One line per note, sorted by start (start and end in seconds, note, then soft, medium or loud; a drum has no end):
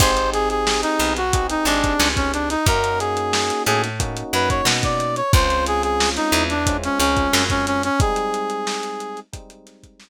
0.00 0.84 G#1 loud
0.00 1.19 C4 medium
0.00 1.19 D#4 medium
0.00 0.12 D#4 medium
0.00 1.19 G4 medium
0.00 0.12 G4 medium
0.00 1.19 G#4 medium
0.00 0.12 G#4 loud
0.00 0.30 C5 medium
0.00 0.12 C5 loud
0.00 kick loud
0.00 closed hi-hat loud
0.17 closed hi-hat medium
0.33 0.49 G#4 medium
0.33 closed hi-hat medium
0.50 0.81 G#4 medium
0.50 closed hi-hat medium
0.67 snare medium
0.82 1.13 D#4 medium
0.82 closed hi-hat medium
0.99 1.56 B1 medium
0.99 1.57 B3 medium
0.99 closed hi-hat medium
1.17 1.47 F#4 medium
1.17 closed hi-hat medium
1.33 2.54 C4 medium
1.33 2.54 D#4 medium
1.33 2.54 G4 medium
1.33 2.54 G#4 medium
1.33 kick medium
1.33 closed hi-hat loud
1.49 1.66 D#4 medium
1.49 closed hi-hat medium
1.65 1.94 G#1 medium
1.65 1.95 G#3 medium
1.65 2.08 D4 medium
1.65 closed hi-hat medium
1.84 kick medium
1.84 closed hi-hat medium
1.99 2.56 C#2 medium
1.99 2.56 C#4 medium
1.99 snare medium
2.16 2.32 C#4 medium
2.16 kick medium
2.16 closed hi-hat medium
2.33 2.49 D4 medium
2.33 closed hi-hat medium
2.50 2.66 D#4 medium
2.50 snare soft
2.50 closed hi-hat medium
2.66 3.51 F#2 loud
2.66 3.87 A#3 medium
2.66 3.87 C#4 medium
2.66 3.87 D#4 medium
2.66 3.87 F#4 medium
2.66 2.99 A#4 medium
2.66 kick medium
2.66 closed hi-hat loud
2.84 closed hi-hat medium
2.99 3.63 G#4 medium
2.99 closed hi-hat medium
3.17 closed hi-hat medium
3.33 snare medium
3.50 closed hi-hat medium
3.66 4.23 A2 loud
3.66 4.23 A3 medium
3.66 3.82 G#4 medium
3.66 closed hi-hat medium
3.83 snare soft
3.83 closed hi-hat medium
4.00 5.20 A#3 medium
4.00 5.20 C#4 medium
4.00 5.20 D#4 medium
4.00 5.20 F#4 medium
4.00 kick medium
4.00 closed hi-hat medium
4.17 closed hi-hat medium
4.33 4.61 F#2 medium
4.33 4.62 F#3 medium
4.33 4.49 B4 medium
4.33 closed hi-hat medium
4.50 4.66 C#5 medium
4.50 kick medium
4.50 closed hi-hat medium
4.65 5.22 B2 medium
4.65 5.23 B3 medium
4.65 snare loud
4.83 5.16 D5 medium
4.83 kick medium
4.83 closed hi-hat medium
5.00 closed hi-hat medium
5.16 5.32 C#5 medium
5.16 closed hi-hat medium
5.33 6.18 C#2 loud
5.33 6.53 G#3 medium
5.33 6.53 C4 medium
5.33 6.53 C#4 medium
5.33 6.53 F4 medium
5.33 5.65 C5 loud
5.33 kick loud
5.33 closed hi-hat medium
5.50 snare soft
5.50 closed hi-hat medium
5.66 5.83 G#4 medium
5.66 closed hi-hat medium
5.83 6.10 G#4 medium
5.83 closed hi-hat medium
6.00 snare medium
6.16 6.44 D#4 medium
6.16 snare soft
6.16 closed hi-hat medium
6.32 6.89 E2 loud
6.32 6.89 E3 medium
6.32 closed hi-hat medium
6.50 6.77 D4 medium
6.50 closed hi-hat medium
6.67 7.87 G#3 medium
6.67 7.87 C4 medium
6.67 7.87 C#4 medium
6.67 7.87 F4 medium
6.67 kick medium
6.67 closed hi-hat loud
6.83 6.99 C#4 medium
6.83 closed hi-hat medium
6.99 7.28 C#2 medium
6.99 7.44 C#4 medium
6.99 7.28 C#4 medium
6.99 snare soft
6.99 closed hi-hat medium
7.17 kick medium
7.17 closed hi-hat medium
7.33 7.90 F#2 medium
7.33 7.90 F#3 medium
7.33 snare medium
7.50 7.66 C#4 medium
7.50 kick medium
7.50 closed hi-hat medium
7.67 7.83 C#4 medium
7.67 closed hi-hat medium
7.83 8.00 C#4 medium
7.83 closed hi-hat medium
8.00 9.21 G3 medium
8.00 9.21 G#3 medium
8.00 9.21 C4 medium
8.00 9.21 D#4 medium
8.00 9.20 G#4 medium
8.00 kick loud
8.00 closed hi-hat medium
8.16 closed hi-hat medium
8.34 closed hi-hat medium
8.50 closed hi-hat medium
8.67 snare medium
8.83 closed hi-hat medium
9.00 closed hi-hat medium
9.17 closed hi-hat medium
9.33 10.09 G3 medium
9.33 10.09 G#3 medium
9.33 10.09 C4 medium
9.33 10.09 D#4 medium
9.33 kick medium
9.33 closed hi-hat medium
9.50 closed hi-hat medium
9.67 snare soft
9.67 closed hi-hat medium
9.83 kick medium
9.83 closed hi-hat medium
10.00 snare medium